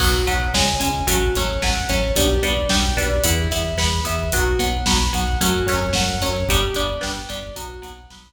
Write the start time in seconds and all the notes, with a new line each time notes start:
0.00 B1 F#3 B3 F#4, kick, crash
0.14 kick
0.27 B1 F#3 B3 F#5, kick, closed hi-hat
0.40 kick
0.54 C#2 G#3 C#4 G#5, kick, snare
0.67 kick
0.80 C#2 G#3 C#4 G#5, kick, closed hi-hat
0.94 kick
1.07 A1 F#3 A3 C#4 F#4, kick, closed hi-hat
1.21 kick
1.35 A1 F#3 A3 C#4 C#5, kick, snare, closed hi-hat
1.49 kick
1.62 A1 F#3 A3 C#4 F#5, kick, snare
1.76 kick
1.89 A1 F#3 A3 C#4 C#5, kick, closed hi-hat
2.04 kick
2.16 B1 G3 B3 D4 G4, kick, closed hi-hat
2.30 kick
2.43 B1 G3 B3 D4 D5, kick, closed hi-hat
2.57 kick
2.69 B1 G3 B3 D4 G5, kick, snare
2.82 kick
2.97 B1 G3 B3 D4 D5, kick, closed hi-hat
3.11 kick
3.24 E2 B3 E4, kick, closed hi-hat
3.39 kick
3.51 E2 B3 E4 E5, kick, snare, closed hi-hat
3.65 kick
3.77 E2 B3 E4 B5, kick, snare
3.92 kick
4.04 E2 B3 E4 E5, kick, closed hi-hat
4.19 kick
4.32 B1 F#3 B3 F#4, kick, closed hi-hat
4.46 kick
4.59 B1 F#3 B3 F#5, kick, closed hi-hat
4.73 kick
4.86 B1 F#3 B3 B5, kick, snare
4.99 kick
5.13 B1 F#3 B3 F#5, kick, closed hi-hat
5.27 kick
5.41 F#2 F#3 A3 C#4 F#4, kick, closed hi-hat
5.54 kick
5.66 F#2 F#3 A3 C#4 C#5, kick, snare, closed hi-hat
5.82 kick
5.93 F#2 F#3 A3 C#4 F#5, kick, snare
6.07 kick
6.21 F#2 F#3 A3 C#4 C#5, kick, closed hi-hat
6.36 kick
6.48 G1 G3 B3 D4 G4, kick, closed hi-hat
6.62 kick
6.74 G1 G3 B3 D4 D5, kick, closed hi-hat
6.89 kick
7.01 G1 G3 B3 D4 G5, kick, snare
7.16 kick
7.29 G1 G3 B3 D4 D5, kick, closed hi-hat
7.43 kick
7.56 B1 F#3 B3 F#4, kick, closed hi-hat
7.70 kick
7.82 B1 F#3 B3 F#5, kick, snare, closed hi-hat
7.98 kick
8.10 B1 F#3 B3 B5, kick, snare
8.26 kick